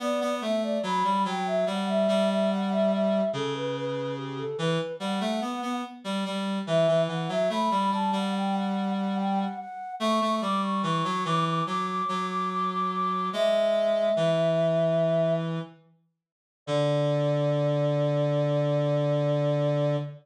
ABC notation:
X:1
M:4/4
L:1/16
Q:1/4=72
K:D
V:1 name="Flute"
d2 e d b2 g e f e2 e f e e2 | A B B2 G A B2 f4 z4 | e2 f e b2 a f g f2 f g f f2 | c'2 d' c' c'2 d' d' d' d'2 d' d' d' d'2 |
e10 z6 | d16 |]
V:2 name="Clarinet"
B, B, A,2 F, G, F,2 G,2 G,6 | C,6 E, z G, A, B, B, z G, G,2 | E, E, E, F, A, G, G, G,7 z2 | A, A, G,2 E, F, E,2 F,2 F,6 |
^G,4 E,8 z4 | D,16 |]